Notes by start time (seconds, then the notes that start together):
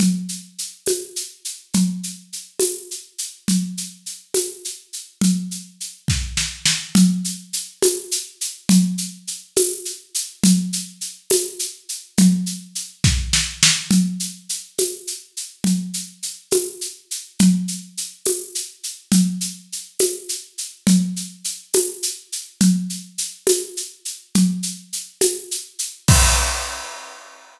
0.00 low conga, shaker
0.29 shaker
0.58 shaker
0.86 tambourine, high conga, shaker
1.16 shaker
1.45 shaker
1.74 low conga, shaker
2.03 shaker
2.33 shaker
2.60 tambourine, high conga, shaker
2.91 shaker
3.18 shaker
3.48 low conga, shaker
3.77 shaker
4.06 shaker
4.34 tambourine, high conga, shaker
4.65 shaker
4.93 shaker
5.21 low conga, shaker
5.51 shaker
5.80 shaker
6.08 kick, snare
6.37 snare
6.65 snare
6.95 low conga, shaker
7.25 shaker
7.53 shaker
7.82 tambourine, high conga, shaker
8.11 shaker
8.41 shaker
8.69 low conga, shaker
8.98 shaker
9.27 shaker
9.56 tambourine, high conga, shaker
9.85 shaker
10.14 shaker
10.43 low conga, shaker
10.73 shaker
11.01 shaker
11.30 tambourine, high conga, shaker
11.59 shaker
11.89 shaker
12.18 low conga, shaker
12.46 shaker
12.75 shaker
13.04 kick, snare
13.33 snare
13.63 snare
13.91 low conga, shaker
14.20 shaker
14.49 shaker
14.78 tambourine, high conga, shaker
15.07 shaker
15.37 shaker
15.64 low conga, shaker
15.94 shaker
16.23 shaker
16.51 tambourine, high conga, shaker
16.81 shaker
17.11 shaker
17.39 low conga, shaker
17.68 shaker
17.97 shaker
18.25 tambourine, high conga, shaker
18.55 shaker
18.83 shaker
19.12 low conga, shaker
19.41 shaker
19.72 shaker
19.99 tambourine, high conga, shaker
20.29 shaker
20.58 shaker
20.87 low conga, shaker
21.16 shaker
21.44 shaker
21.73 tambourine, high conga, shaker
22.03 shaker
22.32 shaker
22.61 low conga, shaker
22.90 shaker
23.18 shaker
23.47 tambourine, high conga, shaker
23.77 shaker
24.05 shaker
24.35 low conga, shaker
24.63 shaker
24.93 shaker
25.21 tambourine, high conga, shaker
25.51 shaker
25.79 shaker
26.08 kick, crash